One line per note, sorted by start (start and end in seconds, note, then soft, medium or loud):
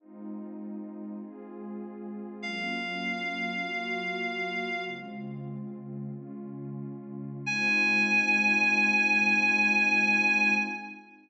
0.00 1.20 G#3 medium
0.00 1.20 C4 medium
0.00 1.20 D#4 medium
0.00 1.20 F4 medium
1.22 2.42 G#3 medium
1.22 2.42 C4 medium
1.22 2.42 F4 medium
1.22 2.42 G#4 medium
2.42 3.63 F#3 medium
2.42 3.63 A#3 medium
2.42 3.63 C#4 medium
2.42 3.63 F4 medium
2.42 4.85 F5 medium
3.63 4.83 F#3 medium
3.63 4.83 A#3 medium
3.63 4.83 F4 medium
3.63 4.83 F#4 medium
4.85 6.09 C#3 medium
4.85 6.09 G#3 medium
4.85 6.09 C4 medium
4.85 6.09 F4 medium
6.11 7.46 C#3 medium
6.11 7.46 G#3 medium
6.11 7.46 C#4 medium
6.11 7.46 F4 medium
7.46 10.55 G#3 loud
7.46 10.55 C4 loud
7.46 10.55 D#4 loud
7.46 10.55 F4 loud
7.46 10.55 G#5 loud